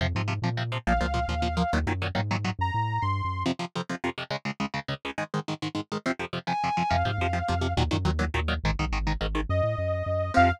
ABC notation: X:1
M:6/8
L:1/16
Q:3/8=139
K:Fphr
V:1 name="Lead 2 (sawtooth)"
z12 | f12 | z12 | b6 c'6 |
z12 | z12 | z12 | z12 |
f12 | z12 | z12 | e12 |
f6 z6 |]
V:2 name="Distortion Guitar"
z12 | z12 | z12 | z12 |
z12 | z12 | z12 | z6 a6 |
z12 | z12 | z12 | z12 |
z12 |]
V:3 name="Overdriven Guitar" clef=bass
[C,F,]2 [C,F,]2 [C,F,]2 [C,F,]2 [C,F,]2 [C,F,]2 | [B,,F,]2 [B,,F,]2 [B,,F,]2 [B,,F,]2 [B,,F,]2 [B,,F,]2 | [B,,E,G,]2 [B,,E,G,]2 [B,,E,G,]2 [B,,E,G,]2 [B,,E,G,]2 [B,,E,G,]2 | z12 |
[F,,C,F,]2 [F,,C,F,]2 [F,,C,F,]2 [F,,C,F,]2 [F,,C,F,]2 [F,,C,F,]2 | [D,,D,A,]2 [D,,D,A,]2 [D,,D,A,]2 [D,,D,A,]2 [D,,D,A,]2 [D,,D,A,]2 | [A,,E,A,]2 [A,,E,A,]2 [A,,E,A,]2 [A,,E,A,]2 [A,,E,A,]2 [A,,E,A,]2 | [F,,C,F,]2 [F,,C,F,]2 [F,,C,F,]2 [F,,C,F,]2 [F,,C,F,]2 [F,,C,F,]2 |
[C,F,]2 [C,F,]2 [C,F,]2 [C,F,]2 [C,F,]2 [C,F,]2 | [B,,E,G,]2 [B,,E,G,]2 [B,,E,G,]2 [B,,E,G,]2 [B,,E,G,]2 [B,,E,G,]2 | [A,,E,]2 [A,,E,]2 [A,,E,]2 [A,,E,]2 [A,,E,]2 [A,,E,]2 | z12 |
[C,F,]6 z6 |]
V:4 name="Synth Bass 1" clef=bass
F,,2 A,,4 B,,6 | B,,,2 D,,4 E,,6 | E,,2 G,,4 A,,6 | G,,2 =A,,4 =G,,3 _G,,3 |
z12 | z12 | z12 | z12 |
F,,2 A,,2 F,,4 F,,4 | E,,2 G,,2 E,,4 E,,4 | A,,,2 =B,,,2 A,,,4 A,,,4 | G,,2 =A,,2 G,,4 G,,4 |
F,,6 z6 |]